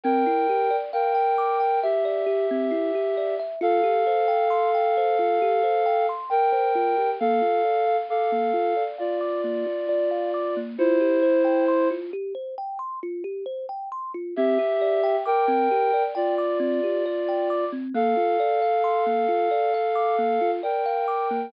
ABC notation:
X:1
M:4/4
L:1/16
Q:1/4=67
K:Cmix
V:1 name="Ocarina"
[Bg]4 [Bg]4 [Ge]8 | [Af]12 [Bg]4 | [Af]4 [Af]4 [Fd]8 | [Ec]6 z10 |
[Ge]4 [Bg]4 [Fd]8 | [Af]12 [Bg]4 |]
V:2 name="Kalimba"
C E G d f g d' g e d G C E G d e | F G c g c' g c F G c g c' g c F G | B, F d f d' B, F d f d' B, F d f d' B, | F G c g c' F G c g c' F G c g c' F |
C G d g d' C G d g d' C G d g d' C | B, F d f c' B, F d f d' B, F d f d' B, |]